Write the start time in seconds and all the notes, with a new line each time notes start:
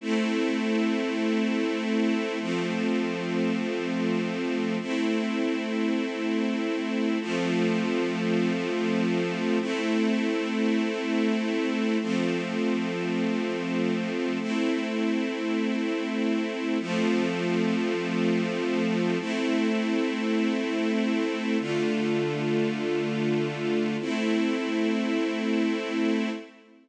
0.01 A3 C4 E4
2.40 F3 A3 C4
4.81 A3 C4 E4
7.21 F3 A3 C4
9.60 A3 C4 E4
12.01 F3 A3 C4
14.40 A3 C4 E4
16.80 F3 A3 C4
19.19 A3 C4 E4
21.59 D3 A3 F4
24.00 A3 C4 E4